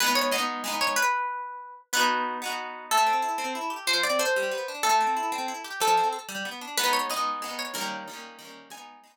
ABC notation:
X:1
M:6/8
L:1/8
Q:3/8=124
K:G#m
V:1 name="Orchestral Harp"
B c d3 c | B6 | B3 z3 | [K:Am] A6 |
c d c3 z | A6 | A2 z4 | [K:G#m] B c d3 c |
A6 | g3 z3 |]
V:2 name="Orchestral Harp"
[G,B,D]2 [G,B,D]2 [G,B,D]2 | z6 | [B,DF]3 [B,DF]3 | [K:Am] A, C E C E G |
F, C A G, B, D | A, C E C E G | F, C A G, B, D | [K:G#m] [G,B,D]2 [G,B,D]2 [G,B,D]2 |
[D,=G,A,C]2 [D,G,A,C]2 [D,G,A,C]2 | [G,B,D]2 [G,B,D]2 z2 |]